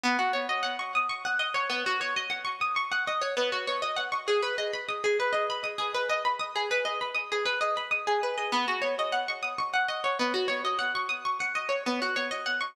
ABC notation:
X:1
M:7/8
L:1/16
Q:1/4=99
K:B
V:1 name="Pizzicato Strings"
B, F c d f c' d' c' f d c B, F c | d f c' d' c' f d c B, F c d f c' | G B d b d' G B d b d' G B d b | d' G B d b d' G B d b d' G B d |
B, F c d f c' d' c' f d c B, F c | d f c' d' c' f d c B, F c d f c' |]